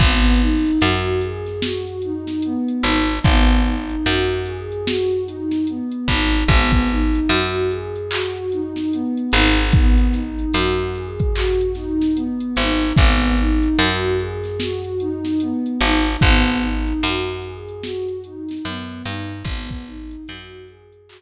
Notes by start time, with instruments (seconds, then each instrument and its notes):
0.00 electric bass (finger) G#1, pad 2 (warm) B3, kick, crash
0.25 closed hi-hat
0.40 pad 2 (warm) D#4, closed hi-hat
0.66 closed hi-hat
0.81 electric bass (finger) F#2, pad 2 (warm) F#4, closed hi-hat
1.05 closed hi-hat
1.21 pad 2 (warm) G#4, closed hi-hat
1.46 snare, closed hi-hat
1.62 pad 2 (warm) F#4, snare
1.88 closed hi-hat
2.02 pad 2 (warm) D#4, closed hi-hat
2.27 snare, closed hi-hat
2.42 pad 2 (warm) B3, closed hi-hat
2.68 closed hi-hat
2.83 electric bass (finger) G#1, pad 2 (warm) D#4, closed hi-hat
3.08 closed hi-hat
3.23 electric bass (finger) G#1, pad 2 (warm) B3, kick, closed hi-hat
3.48 closed hi-hat
3.65 pad 2 (warm) D#4, closed hi-hat
3.90 closed hi-hat
4.05 electric bass (finger) F#2, pad 2 (warm) F#4, closed hi-hat
4.31 closed hi-hat
4.46 pad 2 (warm) G#4, closed hi-hat
4.72 closed hi-hat
4.86 pad 2 (warm) F#4, snare
5.11 closed hi-hat
5.26 pad 2 (warm) D#4, closed hi-hat
5.51 snare, closed hi-hat
5.67 pad 2 (warm) B3, closed hi-hat
5.92 closed hi-hat
6.08 electric bass (finger) G#1, pad 2 (warm) D#4, kick, closed hi-hat
6.32 closed hi-hat
6.48 electric bass (finger) G#1, pad 2 (warm) B3, kick, closed hi-hat
6.72 kick, closed hi-hat
6.88 pad 2 (warm) D#4, closed hi-hat
7.15 closed hi-hat
7.29 electric bass (finger) F#2, pad 2 (warm) F#4, closed hi-hat
7.55 closed hi-hat
7.70 pad 2 (warm) G#4, closed hi-hat
7.96 closed hi-hat
8.11 pad 2 (warm) F#4, clap
8.36 closed hi-hat
8.52 pad 2 (warm) D#4, closed hi-hat
8.76 snare, closed hi-hat
8.92 pad 2 (warm) B3, closed hi-hat
9.17 closed hi-hat
9.32 electric bass (finger) G#1, pad 2 (warm) D#4, closed hi-hat
9.57 closed hi-hat
9.72 pad 2 (warm) B3, kick, closed hi-hat
9.98 snare, closed hi-hat
10.12 pad 2 (warm) D#4, snare, closed hi-hat
10.39 closed hi-hat
10.53 electric bass (finger) F#2, pad 2 (warm) F#4, closed hi-hat
10.79 closed hi-hat
10.95 pad 2 (warm) G#4, closed hi-hat
11.20 kick, closed hi-hat
11.35 pad 2 (warm) F#4, clap
11.61 closed hi-hat
11.75 pad 2 (warm) D#4, snare, closed hi-hat
12.01 snare, closed hi-hat
12.15 pad 2 (warm) B3, closed hi-hat
12.41 closed hi-hat
12.56 electric bass (finger) G#1, pad 2 (warm) D#4, closed hi-hat
12.82 closed hi-hat
12.96 electric bass (finger) G#1, pad 2 (warm) B3, kick, closed hi-hat
13.21 closed hi-hat
13.38 pad 2 (warm) D#4, closed hi-hat
13.63 closed hi-hat
13.79 electric bass (finger) F#2, pad 2 (warm) F#4, closed hi-hat
14.04 closed hi-hat
14.19 pad 2 (warm) G#4, closed hi-hat
14.44 snare, closed hi-hat
14.60 pad 2 (warm) F#4, snare
14.84 closed hi-hat
15.00 pad 2 (warm) D#4, closed hi-hat
15.25 snare, closed hi-hat
15.40 pad 2 (warm) B3, closed hi-hat
15.66 closed hi-hat
15.81 electric bass (finger) G#1, pad 2 (warm) D#4, closed hi-hat
16.06 closed hi-hat
16.21 electric bass (finger) G#1, pad 2 (warm) B3, kick, closed hi-hat
16.45 snare, closed hi-hat
16.61 pad 2 (warm) D#4, closed hi-hat
16.88 closed hi-hat
17.03 electric bass (finger) F#2, pad 2 (warm) F#4, closed hi-hat
17.27 closed hi-hat
17.42 pad 2 (warm) G#4, closed hi-hat
17.69 closed hi-hat
17.83 pad 2 (warm) F#4, snare
18.08 closed hi-hat
18.24 pad 2 (warm) D#4, closed hi-hat
18.49 snare, closed hi-hat
18.65 electric bass (finger) F#2, pad 2 (warm) B3, closed hi-hat
18.90 closed hi-hat
19.04 electric bass (finger) G2, pad 2 (warm) D#4, closed hi-hat
19.31 closed hi-hat
19.44 electric bass (finger) G#1, pad 2 (warm) B3, kick, closed hi-hat
19.70 kick, closed hi-hat
19.86 pad 2 (warm) D#4, closed hi-hat
20.11 closed hi-hat
20.28 electric bass (finger) F#2, pad 2 (warm) F#4, closed hi-hat
20.51 closed hi-hat
20.67 pad 2 (warm) G#4, closed hi-hat
20.93 closed hi-hat
21.07 pad 2 (warm) F#4, clap